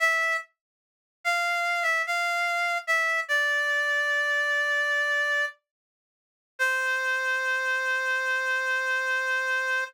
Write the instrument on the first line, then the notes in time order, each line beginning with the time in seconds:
clarinet
0.00 E5
1.24 F5
1.83 E5
2.07 F5
2.87 E5
3.28 D5
6.59 C5